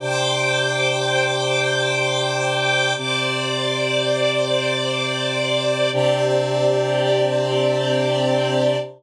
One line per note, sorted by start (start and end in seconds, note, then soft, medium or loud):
0.00 2.93 C3 medium
0.00 2.93 D4 medium
0.00 2.93 G4 medium
0.00 2.94 C5 medium
0.00 2.94 G5 medium
0.00 2.94 D6 medium
2.96 5.90 C3 medium
2.96 5.90 C4 medium
2.96 5.90 G4 medium
2.96 5.90 C5 medium
2.96 5.90 D5 loud
2.96 5.90 D6 medium
5.93 8.76 C3 loud
5.93 8.76 C4 loud
5.93 8.76 D4 loud
5.93 8.76 G4 medium
5.93 8.76 G4 loud
5.93 8.76 D5 loud